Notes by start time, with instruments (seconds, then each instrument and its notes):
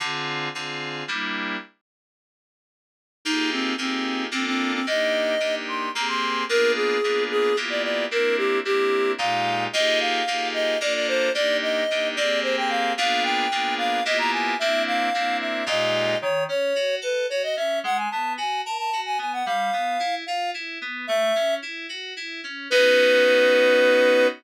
0.00 electric piano 2 D3 C4 F4 G#4
0.55 electric piano 2 D3 C4 F4 G#4
1.08 electric piano 2 G3 A#3 D4 E4
3.25 electric piano 2 A#3 D#4 F4 G4 G#4, clarinet D#4
3.52 clarinet C4
3.78 electric piano 2 A#3 D#4 F4 G4 G#4, clarinet C4
4.31 electric piano 2 A#3 D4 F4 A4, clarinet C4
4.46 clarinet C4
4.73 clarinet C4
4.87 electric piano 2 A#3 D4 D#4 G4, clarinet D#5
5.40 electric piano 2 A#3 D4 D#4 G4
5.68 clarinet C6
5.94 electric piano 2 A#3 C4 G4 G#4, clarinet A#5
6.08 clarinet C6
6.49 electric piano 2 A#3 B3 D4 F4 G#4, clarinet A#4
6.76 clarinet G#4
7.04 electric piano 2 A#3 B3 D4 F4 G#4
7.31 clarinet G#4
7.57 electric piano 2 A#3 B3 E4 F4 G4
7.70 clarinet D5
7.83 clarinet D5
8.11 electric piano 2 A#3 C4 D4 E4, clarinet A#4
8.37 clarinet G4
8.65 electric piano 2 A#3 C4 D4 E4, clarinet G4
9.18 electric piano 2 A#2 G#3 D#4 F4 G4, clarinet F5
9.73 electric piano 2 A#3 D#4 F4 G4 G#4, clarinet D#5
10.00 clarinet F5
10.27 electric piano 2 A#3 D#4 F4 G4 G#4
10.54 clarinet D#5
10.81 electric piano 2 A#3 D4 F4 A4, clarinet D5
10.94 clarinet D5
11.08 clarinet C5
11.34 electric piano 2 A#3 D4 D#4 G4, clarinet D5
11.62 clarinet D#5
11.91 electric piano 2 A#3 D4 D#4 G4
12.16 electric piano 2 A#3 C4 G4 G#4, clarinet D5
12.43 clarinet C5
12.57 clarinet G5
12.69 clarinet F5
12.97 electric piano 2 A#3 B3 D4 F4 G#4, clarinet F5
13.23 clarinet G5
13.51 electric piano 2 A#3 B3 D4 F4 G#4
13.78 clarinet F5
14.05 electric piano 2 A#3 B3 E4 F4 G4, clarinet D#5
14.18 clarinet A#5
14.32 clarinet G#5
14.59 electric piano 2 A#3 C4 D4 E4, clarinet E5
14.87 clarinet F5
15.14 electric piano 2 A#3 C4 D4 E4
15.40 clarinet E5
15.66 electric piano 2 A#2 G#3 D#4 F4 G4, clarinet D#5
16.22 electric piano 2 D#3, clarinet C#5
16.49 electric piano 2 C#4, clarinet C#5
16.75 electric piano 2 F#4
17.01 electric piano 2 A4, clarinet B4
17.30 electric piano 2 F#4, clarinet C#5
17.43 clarinet D#5
17.57 electric piano 2 C#4, clarinet E5
17.84 electric piano 2 G#3, clarinet F#5
17.97 clarinet G#5
18.11 electric piano 2 B3, clarinet A5
18.38 electric piano 2 F#4, clarinet G#5
18.65 electric piano 2 A#4, clarinet A5
18.78 clarinet A5
18.93 electric piano 2 F#4
19.06 clarinet G#5
19.18 electric piano 2 B3, clarinet G#5
19.33 clarinet F#5
19.46 electric piano 2 G3, clarinet F5
19.73 electric piano 2 B3
20.00 electric piano 2 E4
20.26 electric piano 2 F4, clarinet F5
20.54 electric piano 2 E4
20.81 electric piano 2 B3
21.07 electric piano 2 A3, clarinet E5
21.35 electric piano 2 C#4
21.62 electric piano 2 E4
21.89 electric piano 2 F#4
22.17 electric piano 2 E4
22.44 electric piano 2 C#4
22.70 electric piano 2 B3 C#4 D#4 F#4, clarinet B4